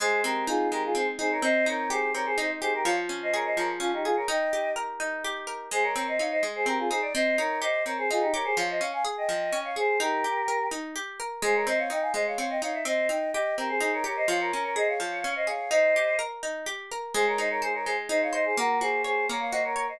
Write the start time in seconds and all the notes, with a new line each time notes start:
0.00 G#3 G#4 C5
0.24 C4 G4 A#4
0.47 D#4 F4 G#4
0.71 G#3 G4 A#4
0.85 F4 G#4
0.95 C4 G#4 C5
1.19 D#4 G#4 C5
1.32 A#4 C#5
1.42 C4 C5 D#5
1.66 D#4 A#4 C#5
1.90 G4 G#4 C5
2.14 C4 A#4 C#5
2.25 G#4 C5
2.38 D#4 C5 D#5
2.61 G4 G#4 C5
2.74 G4 A#4
2.84 F3 C#5 F5
3.09 C#4
3.22 C5 D#5
3.34 G#4 A#4 C#5
3.45 C5 D#5
3.57 F3 A#4 C#5
3.80 C#4 F4
3.93 D#4 G4
4.04 F4 G#4
4.16 A#4 C#5
4.28 D#4 D#5 G5
4.53 G4
4.76 A#4
5.00 D#4
5.24 G4
5.47 A#4
5.71 G#3 G#4 C5
5.83 A#4 C#5
5.95 C4 A#4 C#5
6.08 C5 D#5
6.19 D#4 C#5 F5
6.31 C5 D#5
6.43 G#3
6.55 G#4 C5
6.66 C4 G4 A#4
6.79 F4 G#4
6.89 D#4 G#4 C5
7.02 D5
7.14 C4 C5 D#5
7.38 D#4 A#4 C#5
7.62 G4 C5 D#5
7.85 C4 A#4 C#5
7.98 G#4 C5
8.11 D#4 F4 G#4
8.21 D#4 G4
8.33 G4 A#4 C#5
8.44 G#4 C5
8.57 F3 C#5 F5
8.70 C5 D#5
8.80 C#4 C#5 F5
8.93 F5 G#5
9.05 G#4
9.17 D#5 G5
9.29 F3
9.52 C#4
9.64 C#5 F5
9.76 G#4 C5
10.00 D#4 G4 A#4
10.24 G4
10.48 A#4
10.71 D#4
10.96 G4
11.20 A#4
11.42 G#3 G#4 C5
11.55 A#4 C#5
11.67 C4 C5 D#5
11.78 C#5 F5
11.90 D#4 D#5 G5
12.01 F5 G#5
12.14 G#3 C5 D#5
12.27 C#5 F5
12.38 C4 C#5 F5
12.49 D#5 G5
12.62 D#4 C#5 F5
12.73 E5
12.85 C4 C5 D#5
13.09 D#4 D#5 G5
13.33 G4 D#5 G5
13.57 C4 G4 A#4
13.69 G#4 C5
13.80 D#4 G#4 C5
13.93 A#4 C#5
14.04 G4 A#4 C#5
14.16 C5 D#5
14.28 F3 C#5 F5
14.40 A#4 C#5
14.53 C#4 A#4 C#5
14.64 A#4 C#5
14.76 G#4 C5 D#5
14.88 C#5 F5
15.00 F3
15.24 C#4
15.35 C5 D#5
15.47 G#4 C#5 F5
15.71 D#4 C5 D#5
15.96 G4
16.19 A#4
16.43 D#4
16.66 G4
16.91 A#4
17.14 G#3 G#4 C5
17.27 A#4 C#5
17.38 D#4 C5 D#5
17.50 A#4 C#5
17.62 G#4 C5
17.74 A#4 C#5
17.85 G#3 G#4 C5
18.09 D#4 C5 D#5
18.22 C#5 F5
18.33 C5 D#5
18.45 G#4 C5
18.57 A#3 F#4 A#4
18.80 F#4 G#4 C5
19.04 G#4 C5 C#5
19.29 A#3 A#4 C#5
19.40 C#5 F5
19.51 F#4 C5 D#5
19.64 A#4 C#5
19.76 A#4 C#5
19.89 C5 D#5